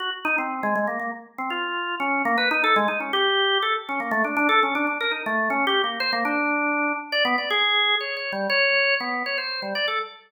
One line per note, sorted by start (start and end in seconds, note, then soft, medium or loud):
0.00 0.10 F#4 medium
0.25 0.36 D#4 loud
0.38 0.61 C4 medium
0.63 0.74 G#3 medium
0.76 0.87 G#3 medium
0.87 0.99 A#3 medium
1.00 1.11 A#3 medium
1.38 1.50 C4 medium
1.50 1.95 F4 medium
2.00 2.22 C#4 medium
2.25 2.36 A#3 loud
2.38 2.49 B4 medium
2.51 2.62 D#4 loud
2.64 2.75 A4 loud
2.76 2.87 G#3 loud
2.88 2.99 D#4 medium
3.00 3.12 C#4 soft
3.13 3.58 G4 loud
3.62 3.74 A4 medium
3.89 4.00 C#4 medium
4.00 4.11 A#3 medium
4.11 4.23 A3 loud
4.24 4.36 D4 medium
4.37 4.48 D4 loud
4.49 4.60 A4 loud
4.63 4.74 C#4 medium
4.75 4.86 D4 loud
4.87 4.98 D4 medium
5.01 5.12 A#4 medium
5.11 5.23 D#4 medium
5.26 5.49 A3 medium
5.50 5.65 C#4 medium
5.67 5.82 G4 loud
5.84 5.99 A#3 soft
6.00 6.11 C5 loud
6.13 6.24 A#3 medium
6.25 6.92 D4 medium
7.12 7.24 D5 loud
7.25 7.36 B3 loud
7.38 7.49 D5 medium
7.50 7.95 G#4 loud
8.00 8.15 C#5 medium
8.17 8.32 C#5 medium
8.32 8.47 G3 medium
8.50 8.95 C#5 loud
9.00 9.23 B3 medium
9.26 9.37 C#5 medium
9.38 9.60 C5 medium
9.62 9.74 G3 medium
9.75 9.86 D5 medium
9.88 9.99 A4 medium